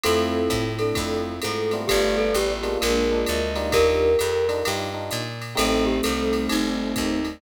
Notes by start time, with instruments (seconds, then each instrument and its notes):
0.03 electric bass (finger) F2, string ensemble 1 A3 C4 E4 F4, electric piano 1 A3 C4 E4 F4, violin C4 E4, glockenspiel A4, ride
0.50 electric bass (finger) A2, kick, hi-hat pedal, ride
0.79 violin D4, glockenspiel A4, ride
0.95 electric bass (finger) F2, electric piano 1 A3 C4 E4 F4, kick, ride
1.42 electric bass (finger) G#2, glockenspiel A4, hi-hat pedal, ride
1.71 electric piano 1 G3 A3 B3 F4, ride
1.88 electric bass (finger) G1, string ensemble 1 G3 A3 B3 F4, glockenspiel G4, violin B4 D5, kick, ride
2.18 glockenspiel A4
2.34 electric bass (finger) A1, glockenspiel G4, hi-hat pedal, ride
2.63 electric piano 1 G#3 A#3 D4 F4, ride
2.81 electric bass (finger) A#1, string ensemble 1 G#3 A#3 D4 F4, glockenspiel A#4, ride
3.11 electric piano 1 G#3 A#3 D4 F4
3.26 electric bass (finger) D2, violin D#5, hi-hat pedal, ride
3.55 electric piano 1 G3 D4 D#4 F4, ride
3.72 electric bass (finger) D#2, violin G4 A#4, glockenspiel A#4, kick, ride
4.19 electric bass (finger) F2, hi-hat pedal, ride
4.48 electric piano 1 G3 D4 D#4 F4, ride
4.65 electric bass (finger) G2, electric piano 1 G3 D4 D#4 F4, ride
4.94 electric piano 1 G3 D4 D#4 F4
5.11 electric bass (finger) A#2, hi-hat pedal, ride
5.41 ride
5.55 electric bass (finger) A1, electric piano 1 G3 A3 C4 D#4, string ensemble 1 G3 A3 C4 D#4, violin A3 C4, glockenspiel A4, ride
5.86 glockenspiel G4
6.03 electric bass (finger) C2, glockenspiel A4, hi-hat pedal, ride
6.33 ride
6.49 electric bass (finger) G1, glockenspiel D#4, ride
6.96 electric bass (finger) D#2, kick, hi-hat pedal, ride
7.25 ride